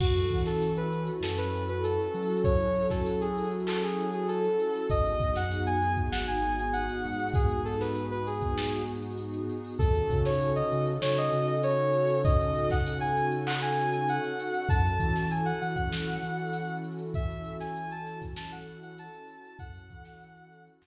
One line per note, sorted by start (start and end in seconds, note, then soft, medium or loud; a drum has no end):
0.00 0.26 F#2 loud
0.00 4.80 C#4 medium
0.00 4.80 E4 medium
0.00 4.80 F#4 medium
0.00 0.38 F#4 loud
0.00 4.80 A4 medium
0.00 kick loud
0.00 crash loud
0.15 closed hi-hat medium
0.31 1.10 E3 medium
0.31 kick medium
0.31 closed hi-hat medium
0.38 closed hi-hat medium
0.46 0.73 A4 medium
0.46 snare medium
0.46 closed hi-hat medium
0.54 closed hi-hat medium
0.61 closed hi-hat loud
0.76 1.03 B4 medium
0.76 closed hi-hat medium
0.92 closed hi-hat medium
1.07 closed hi-hat medium
1.20 1.98 F#2 medium
1.20 1.37 A4 medium
1.20 snare loud
1.38 1.63 B4 medium
1.38 closed hi-hat medium
1.53 closed hi-hat loud
1.68 1.84 B4 medium
1.68 closed hi-hat medium
1.83 2.37 A4 medium
1.83 closed hi-hat loud
1.99 closed hi-hat medium
2.14 4.48 F#3 medium
2.14 closed hi-hat medium
2.23 closed hi-hat medium
2.29 closed hi-hat medium
2.37 closed hi-hat medium
2.44 2.86 C#5 medium
2.44 kick loud
2.44 closed hi-hat loud
2.60 closed hi-hat medium
2.75 closed hi-hat medium
2.83 closed hi-hat medium
2.90 3.19 A4 medium
2.90 kick medium
2.90 snare medium
2.90 closed hi-hat medium
2.99 closed hi-hat medium
3.06 closed hi-hat loud
3.21 3.49 G#4 medium
3.21 closed hi-hat medium
3.37 closed hi-hat loud
3.45 closed hi-hat medium
3.51 closed hi-hat medium
3.60 closed hi-hat medium
3.67 3.82 A4 medium
3.67 clap loud
3.83 4.09 G#4 medium
3.83 closed hi-hat medium
3.99 closed hi-hat medium
4.13 4.28 G#4 medium
4.13 closed hi-hat medium
4.28 4.86 A4 medium
4.28 closed hi-hat loud
4.44 closed hi-hat medium
4.59 closed hi-hat medium
4.74 closed hi-hat medium
4.90 5.16 G#1 loud
4.90 9.70 B3 medium
4.90 9.70 D#4 medium
4.90 9.70 F#4 medium
4.90 9.70 G#4 medium
4.90 5.30 D#5 loud
4.90 kick loud
4.90 closed hi-hat loud
5.06 closed hi-hat medium
5.20 5.98 F#2 medium
5.20 kick loud
5.20 closed hi-hat medium
5.36 5.61 F#5 loud
5.36 snare medium
5.36 closed hi-hat medium
5.51 closed hi-hat loud
5.66 5.92 G#5 loud
5.66 closed hi-hat medium
5.82 closed hi-hat medium
5.97 kick medium
5.97 closed hi-hat medium
6.11 6.89 G#1 medium
6.11 6.26 F#5 medium
6.11 snare loud
6.27 6.52 G#5 medium
6.27 closed hi-hat medium
6.43 closed hi-hat medium
6.59 6.74 G#5 medium
6.59 closed hi-hat medium
6.73 7.29 F#5 medium
6.73 closed hi-hat loud
6.88 closed hi-hat medium
7.04 9.39 G#2 medium
7.04 closed hi-hat medium
7.12 closed hi-hat medium
7.19 closed hi-hat medium
7.27 closed hi-hat medium
7.34 7.61 G#4 medium
7.34 kick loud
7.34 closed hi-hat loud
7.50 closed hi-hat medium
7.65 7.79 A4 medium
7.65 closed hi-hat medium
7.72 closed hi-hat medium
7.81 8.05 B4 medium
7.81 snare medium
7.81 closed hi-hat medium
7.88 closed hi-hat medium
7.95 closed hi-hat loud
8.11 8.26 B4 medium
8.11 closed hi-hat medium
8.27 8.81 G#4 medium
8.27 closed hi-hat medium
8.41 kick medium
8.41 closed hi-hat medium
8.58 snare loud
8.72 closed hi-hat medium
8.88 closed hi-hat medium
8.95 closed hi-hat medium
9.02 closed hi-hat medium
9.10 closed hi-hat medium
9.17 closed hi-hat loud
9.34 closed hi-hat medium
9.49 closed hi-hat medium
9.65 open hi-hat medium
9.79 10.05 D#2 loud
9.79 14.60 C#4 medium
9.79 14.60 D#4 medium
9.79 14.60 F#4 medium
9.79 10.18 A4 loud
9.79 14.60 A4 medium
9.79 kick loud
9.79 closed hi-hat loud
9.95 closed hi-hat medium
10.10 10.62 C#3 loud
10.10 kick loud
10.10 closed hi-hat loud
10.25 10.50 C#5 medium
10.25 snare medium
10.25 closed hi-hat medium
10.41 closed hi-hat loud
10.56 10.85 D#5 medium
10.56 closed hi-hat medium
10.72 10.98 C#3 medium
10.72 closed hi-hat medium
10.86 closed hi-hat medium
11.02 11.29 C#3 medium
11.02 11.16 C#5 loud
11.02 snare loud
11.18 11.46 D#5 loud
11.18 closed hi-hat medium
11.32 14.18 C#3 medium
11.32 closed hi-hat loud
11.47 11.61 D#5 medium
11.47 closed hi-hat medium
11.63 12.18 C#5 loud
11.63 closed hi-hat loud
11.79 closed hi-hat medium
11.93 closed hi-hat loud
12.09 closed hi-hat loud
12.24 12.68 D#5 loud
12.24 kick loud
12.24 closed hi-hat loud
12.41 closed hi-hat medium
12.55 closed hi-hat medium
12.70 12.98 F#5 medium
12.70 kick loud
12.70 snare medium
12.70 closed hi-hat medium
12.86 closed hi-hat loud
13.00 13.25 G#5 loud
13.00 closed hi-hat medium
13.17 closed hi-hat loud
13.32 closed hi-hat medium
13.47 13.61 F#5 medium
13.47 clap loud
13.62 13.89 G#5 medium
13.62 closed hi-hat medium
13.78 closed hi-hat loud
13.92 14.07 G#5 loud
13.92 closed hi-hat loud
14.08 14.67 F#5 medium
14.08 closed hi-hat loud
14.23 closed hi-hat medium
14.39 closed hi-hat loud
14.54 closed hi-hat medium
14.69 14.95 F#2 loud
14.69 19.50 C#4 medium
14.69 19.50 E4 medium
14.69 19.50 F#4 medium
14.69 19.50 A4 medium
14.69 15.26 A5 medium
14.69 kick loud
14.69 closed hi-hat loud
14.84 closed hi-hat medium
15.00 15.52 E3 loud
15.00 kick loud
15.00 closed hi-hat loud
15.15 snare medium
15.15 closed hi-hat medium
15.30 15.45 G#5 medium
15.30 closed hi-hat loud
15.45 15.60 F#5 medium
15.45 closed hi-hat medium
15.61 15.88 E3 medium
15.61 15.75 F#5 loud
15.61 closed hi-hat loud
15.76 16.74 F#5 loud
15.76 kick loud
15.76 closed hi-hat medium
15.91 16.17 E3 medium
15.91 snare loud
16.08 closed hi-hat medium
16.22 19.08 E3 medium
16.22 closed hi-hat loud
16.30 closed hi-hat medium
16.38 closed hi-hat medium
16.46 closed hi-hat medium
16.53 closed hi-hat loud
16.69 closed hi-hat medium
16.84 closed hi-hat loud
16.91 closed hi-hat medium
16.99 closed hi-hat medium
17.06 closed hi-hat medium
17.14 17.53 E5 loud
17.14 kick loud
17.14 closed hi-hat loud
17.30 closed hi-hat medium
17.45 closed hi-hat loud
17.60 17.90 G#5 loud
17.60 snare medium
17.60 closed hi-hat medium
17.76 closed hi-hat loud
17.90 18.19 A5 loud
17.90 closed hi-hat medium
18.06 snare soft
18.06 closed hi-hat loud
18.22 kick loud
18.22 snare soft
18.22 closed hi-hat loud
18.36 18.51 A5 medium
18.36 snare loud
18.52 18.78 F#5 medium
18.52 closed hi-hat medium
18.68 closed hi-hat medium
18.83 18.97 F#5 medium
18.83 closed hi-hat loud
18.98 19.57 A5 medium
18.98 closed hi-hat loud
19.14 closed hi-hat loud
19.28 closed hi-hat loud
19.45 closed hi-hat medium
19.59 19.85 F#2 loud
19.59 20.87 C#4 loud
19.59 20.87 E4 medium
19.59 20.87 F#4 medium
19.59 20.87 A4 loud
19.59 20.64 F#5 loud
19.59 kick loud
19.59 closed hi-hat loud
19.74 closed hi-hat loud
19.90 20.69 E3 loud
19.90 kick loud
19.90 closed hi-hat loud
20.05 snare medium
20.05 closed hi-hat medium
20.20 closed hi-hat loud
20.37 closed hi-hat medium
20.52 closed hi-hat medium
20.66 closed hi-hat medium
20.82 20.87 F#2 loud
20.82 clap loud